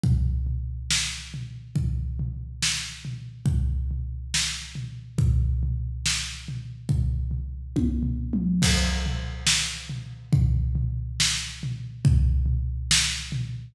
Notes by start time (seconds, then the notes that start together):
0.04 kick, floor tom
0.47 floor tom
0.91 snare
1.34 floor tom
1.76 kick, floor tom
2.20 floor tom
2.63 snare
3.05 floor tom
3.46 kick, floor tom
3.91 floor tom
4.34 snare
4.75 floor tom
5.18 kick, floor tom
5.63 floor tom
6.06 snare
6.48 floor tom
6.89 kick, floor tom
7.31 floor tom
7.76 kick, high tom
8.03 floor tom
8.33 mid tom
8.62 kick, crash
9.06 floor tom
9.47 snare
9.90 floor tom
10.33 kick, floor tom
10.75 floor tom
11.20 snare
11.63 floor tom
12.05 kick, floor tom
12.46 floor tom
12.91 snare
13.32 floor tom